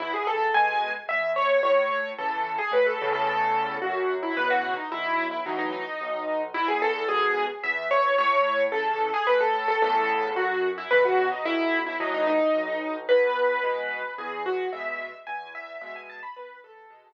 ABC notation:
X:1
M:3/4
L:1/16
Q:1/4=110
K:E
V:1 name="Acoustic Grand Piano"
E G A2 g3 z e2 c2 | c4 A3 G B A2 A | A4 F3 E B F2 D | E3 E D D D6 |
E G A2 G3 z e2 c2 | c4 A3 G B A2 A | A4 F3 E B F2 D | E3 E D D D6 |
B8 G2 F2 | e4 g2 e2 e g a b | B2 A10 |]
V:2 name="Acoustic Grand Piano" clef=bass
E,,4 [B,,G,]4 E,,4 | A,,4 [C,E,]4 A,,2 [E,,A,,C,]2- | [E,,A,,C,]4 F,,4 [B,,C,E,]4 | B,,,4 [A,,E,F,]4 B,,,4 |
E,,4 [G,,B,,]4 E,,4 | A,,4 [C,E,]4 A,,4 | [E,,A,,C,]4 F,,4 [B,,C,E,]4 | B,,,4 [A,,E,F,]4 B,,,4 |
E,,4 [B,,G,]4 E,,4 | [B,,G,]4 E,,4 [B,,G,]4 | E,,4 [B,,G,]4 z4 |]